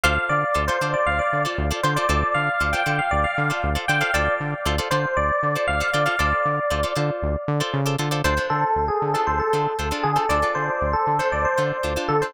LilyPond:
<<
  \new Staff \with { instrumentName = "Electric Piano 1" } { \time 4/4 \key d \dorian \tempo 4 = 117 f''8 d''8. c''8 d''16 f''16 d''8 r8. c''16 d''16 | d''8 f''8. g''8 f''16 d''16 f''8 r8. g''16 f''16 | d''8 r4 c''8 d''4 f''8 d''16 f''16 | d''4. r2 r8 |
c''8 a'8. gis'8 a'16 c''16 a'8 r8. gis'16 a'16 | d''8 c''8. a'8 c''16 d''16 c''8 r8. a'16 c''16 | }
  \new Staff \with { instrumentName = "Acoustic Guitar (steel)" } { \time 4/4 \key d \dorian <f' a' c'' d''>4 <f' a' c'' d''>16 <f' a' c'' d''>16 <f' a' c'' d''>4~ <f' a' c'' d''>16 <f' a' c'' d''>8 <f' a' c'' d''>16 <f' a' c'' d''>16 <f' a' c'' d''>16 | <f' a' c'' d''>4 <f' a' c'' d''>16 <f' a' c'' d''>16 <f' a' c'' d''>4~ <f' a' c'' d''>16 <f' a' c'' d''>8 <f' a' c'' d''>16 <f' a' c'' d''>16 <f' a' c'' d''>16 | <f' a' c'' d''>4 <f' a' c'' d''>16 <f' a' c'' d''>16 <f' a' c'' d''>4~ <f' a' c'' d''>16 <f' a' c'' d''>8 <f' a' c'' d''>16 <f' a' c'' d''>16 <f' a' c'' d''>16 | <f' a' c'' d''>4 <f' a' c'' d''>16 <f' a' c'' d''>16 <f' a' c'' d''>4~ <f' a' c'' d''>16 <f' a' c'' d''>8 <f' a' c'' d''>16 <f' a' c'' d''>16 <f' a' c'' d''>16 |
<d' f' a' c''>16 <d' f' a' c''>4. <d' f' a' c''>8. <d' f' a' c''>8 <d' f' a' c''>16 <d' f' a' c''>8 <d' f' a' c''>16 | <d' f' a' c''>16 <d' f' a' c''>4. <d' f' a' c''>8. <d' f' a' c''>8 <d' f' a' c''>16 <d' f' a' c''>8 <d' f' a' c''>16 | }
  \new Staff \with { instrumentName = "Synth Bass 1" } { \clef bass \time 4/4 \key d \dorian d,8 d8 d,8 d8 d,8 d8 d,8 d8 | d,8 d8 d,8 d8 d,8 d8 d,8 d8 | d,8 d8 d,8 d8 d,8 d8 d,8 d8 | d,8 d8 d,8 d8 d,8 d8 cis8 d8 |
d,8 d8 d,8 d8 d,8 d8 d,8 d8 | d,8 d8 d,8 d8 d,8 d8 d,8 d8 | }
>>